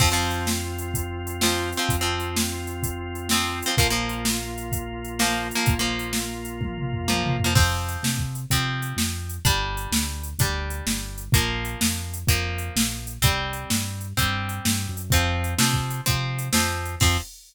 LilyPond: <<
  \new Staff \with { instrumentName = "Acoustic Guitar (steel)" } { \time 4/4 \key f \dorian \tempo 4 = 127 <f c'>16 <f c'>2~ <f c'>8. <f c'>8. <f c'>16~ | <f c'>16 <f c'>2~ <f c'>8. <f c'>8. <f c'>16 | <f bes>16 <f bes>2~ <f bes>8. <f bes>8. <f bes>16~ | <f bes>16 <f bes>2~ <f bes>8. <f bes>8. <f bes>16 |
<f c'>2 <f c'>2 | <g d'>2 <g d'>2 | <f bes>2 <f bes>2 | <g c'>2 <g c'>2 |
<f c'>4 <f c'>4 <f c'>4 <f c'>4 | <f c'>4 r2. | }
  \new Staff \with { instrumentName = "Drawbar Organ" } { \time 4/4 \key f \dorian <c' f'>1~ | <c' f'>1 | <bes f'>1~ | <bes f'>1 |
r1 | r1 | r1 | r1 |
r1 | r1 | }
  \new Staff \with { instrumentName = "Synth Bass 1" } { \clef bass \time 4/4 \key f \dorian f,1 | f,1 | bes,,1 | bes,,1 |
f,4 c4 c4 f,4 | g,,4 d,4 d,4 g,,4 | bes,,4 f,4 f,4 bes,,4 | c,4 g,4 g,4 g,8 ges,8 |
f,4 c4 c4 f,4 | f,4 r2. | }
  \new DrumStaff \with { instrumentName = "Drums" } \drummode { \time 4/4 \tuplet 3/2 { <cymc bd>8 r8 hh8 sn8 r8 hh8 <hh bd>8 r8 hh8 sn8 r8 hh8 } | \tuplet 3/2 { <hh bd>8 r8 hh8 sn8 r8 hh8 <hh bd>8 r8 hh8 sn8 r8 hh8 } | \tuplet 3/2 { <hh bd>8 r8 hh8 sn8 r8 hh8 <hh bd>8 r8 hh8 sn8 r8 hh8 } | \tuplet 3/2 { <hh bd>8 r8 hh8 sn8 r8 hh8 <bd tommh>8 toml8 tomfh8 tommh8 toml8 tomfh8 } |
\tuplet 3/2 { <cymc bd>8 r8 hh8 sn8 bd8 hh8 <hh bd>8 r8 hh8 sn8 r8 hh8 } | \tuplet 3/2 { <hh bd>8 r8 hh8 sn8 r8 hh8 <hh bd>8 r8 hh8 sn8 r8 hh8 } | \tuplet 3/2 { <hh bd>8 r8 hh8 sn8 r8 hh8 <hh bd>8 r8 hh8 sn8 r8 hh8 } | \tuplet 3/2 { <hh bd>8 r8 hh8 sn8 r8 hh8 <hh bd>8 r8 hh8 sn8 r8 hh8 } |
\tuplet 3/2 { <hh bd>8 r8 hh8 sn8 bd8 hh8 <hh bd>8 r8 hh8 sn8 r8 hh8 } | <cymc bd>4 r4 r4 r4 | }
>>